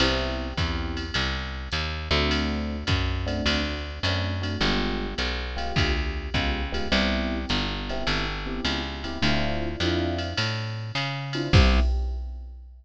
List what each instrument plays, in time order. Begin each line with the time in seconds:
0.00 electric bass (finger) C2, electric piano 1 B3 C4 E4 G4, ride
0.57 electric bass (finger) E2, electric piano 1 B3 C4 E4 G4, kick, hi-hat pedal, ride
0.97 ride
1.14 electric bass (finger) C2, ride
1.72 electric bass (finger) D#2, hi-hat pedal, ride
2.11 electric bass (finger) D2, electric piano 1 A3 C4 D4 F#4, ride
2.31 ride
2.87 electric bass (finger) F#2, kick, hi-hat pedal, ride
3.26 electric piano 1 A3 C4 D4 F#4, ride
3.46 electric bass (finger) D2, ride
4.03 electric bass (finger) F#2, electric piano 1 A3 C4 D4 F#4, hi-hat pedal, ride
4.42 electric piano 1 A3 C4 D4 F#4, ride
4.61 electric bass (finger) G1, electric piano 1 G#3 B3 F4 G4, ride
5.18 electric bass (finger) B1, hi-hat pedal, ride
5.57 electric piano 1 G#3 B3 F4 G4, ride
5.76 electric bass (finger) D2, kick, ride
6.34 electric bass (finger) C#2, electric piano 1 G#3 B3 F4 G4, kick, hi-hat pedal, ride
6.72 electric piano 1 G#3 B3 F4 G4, ride
6.92 electric bass (finger) C2, electric piano 1 B3 C4 E4 G4, ride
7.49 electric bass (finger) G1, hi-hat pedal, ride
7.89 electric piano 1 B3 C4 E4 G4, ride
8.07 electric bass (finger) G1, ride
8.46 electric piano 1 B3 C4 E4 G4
8.65 electric bass (finger) C#2, hi-hat pedal, ride
9.04 electric piano 1 B3 C4 E4 G4, ride
9.22 electric bass (finger) D2, electric piano 1 C4 D4 E4 F4, ride
9.80 electric bass (finger) F2, electric piano 1 C4 D4 E4 F4, hi-hat pedal, ride
10.18 ride
10.37 electric bass (finger) A2, ride
10.95 electric bass (finger) C#3, hi-hat pedal, ride
11.33 electric piano 1 C4 D4 E4 F4, ride
11.53 electric bass (finger) C2, electric piano 1 B3 C4 E4 G4, kick, crash